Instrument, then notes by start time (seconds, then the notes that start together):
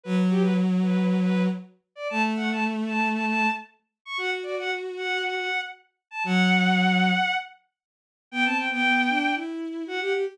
violin
0.03 F#3 B4
0.29 G4
0.41 B4
0.82 B4
1.05 B4
1.20 B4
1.95 D5
2.09 A3 A5
2.36 F#5
2.51 A5
2.86 A5
3.13 A5
3.25 A5
4.05 C#6
4.17 F#4 F#5
4.43 D5
4.59 F#5
4.97 F#5
5.23 F#5
5.36 F#5
6.11 A5
6.24 F#3 F#5
8.31 B3 G5
8.45 C4 A5
8.56 G5
8.70 B3 G5
8.84 B3
9.09 D4
9.35 E4
9.86 F#4 F#5
10.01 G4 F#5
10.12 G4
10.26 G4